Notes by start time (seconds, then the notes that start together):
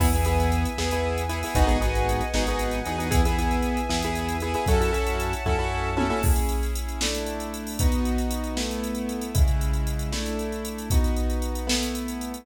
0.00 E2 B3 E4 G#4 B4 E5 G#5, kick, crash
0.13 B3 E4 G#4, closed hi-hat
0.25 B3 E4 G#4, closed hi-hat
0.40 closed hi-hat
0.52 closed hi-hat
0.65 closed hi-hat
0.78 E2 B3 E4 G#4, snare
0.91 B3 E4 G#4, closed hi-hat
1.18 closed hi-hat
1.29 B3 E4 G#4, closed hi-hat
1.43 B3 E4 G#4, open hi-hat
1.55 G#1 B3 D#4 F#4 G#4 B4 D#5 F#5 G#5, kick, closed hi-hat
1.67 B3 D#4 F#4 G#4, closed hi-hat
1.81 B3 D#4 F#4 G#4, closed hi-hat
1.95 closed hi-hat
2.09 closed hi-hat
2.21 closed hi-hat
2.34 G#1 B3 D#4 F#4 G#4, snare
2.47 B3 D#4 F#4 G#4, closed hi-hat
2.59 closed hi-hat
2.71 closed hi-hat
2.85 E2 B3 D#4 F#4 G#4, closed hi-hat
2.98 B3 D#4 F#4 G#4, closed hi-hat
3.11 B3 E4 G#4 B4 E5 G#5, kick, closed hi-hat
3.25 B3 E4 G#4, closed hi-hat
3.39 B3 E4 G#4, closed hi-hat
3.51 closed hi-hat
3.63 closed hi-hat
3.77 closed hi-hat
3.89 E2 B3 E4 G#4, snare
4.02 B3 E4 G#4, closed hi-hat
4.15 closed hi-hat
4.29 closed hi-hat
4.40 B3 E4 G#4, closed hi-hat
4.54 B3 E4 G#4, closed hi-hat
4.66 F#2 C#4 E4 F#4 A4 C#5 E5 F#5 A5, kick, closed hi-hat
4.81 C#4 E4 F#4 A4, closed hi-hat
4.93 C#4 E4 F#4 A4, closed hi-hat
5.07 closed hi-hat
5.20 closed hi-hat
5.33 closed hi-hat
5.46 F#2 C#4 E4 F#4 A4, kick
5.59 C#4 E4 F#4 A4
5.97 C#4 E4 F#4 A4, high tom
6.10 C#4 E4 F#4 A4
6.23 C#4 E4 G#4, kick, crash
6.36 closed hi-hat
6.49 closed hi-hat
6.63 closed hi-hat
6.75 closed hi-hat
6.89 closed hi-hat
7.00 A3 D4 E4, snare
7.15 closed hi-hat
7.26 closed hi-hat
7.40 closed hi-hat
7.54 closed hi-hat
7.67 open hi-hat
7.79 B3 D#4 F#4, kick, closed hi-hat
7.92 closed hi-hat
8.05 closed hi-hat
8.18 closed hi-hat
8.31 closed hi-hat
8.44 closed hi-hat
8.57 A3 B3 E4, snare
8.71 closed hi-hat
8.84 closed hi-hat
8.95 closed hi-hat
9.09 closed hi-hat
9.21 closed hi-hat
9.35 C#3 G#3 E4, kick, closed hi-hat
9.48 closed hi-hat
9.61 closed hi-hat
9.73 closed hi-hat
9.87 closed hi-hat
9.99 closed hi-hat
10.12 A3 D4 E4, snare
10.26 closed hi-hat
10.39 closed hi-hat
10.52 closed hi-hat
10.65 closed hi-hat
10.78 closed hi-hat
10.90 B3 D#4 F#4, kick, closed hi-hat
11.04 closed hi-hat
11.16 closed hi-hat
11.30 closed hi-hat
11.42 closed hi-hat
11.55 closed hi-hat
11.67 A3 B3 E4, snare
11.83 closed hi-hat
11.95 closed hi-hat
12.08 closed hi-hat
12.21 closed hi-hat
12.34 closed hi-hat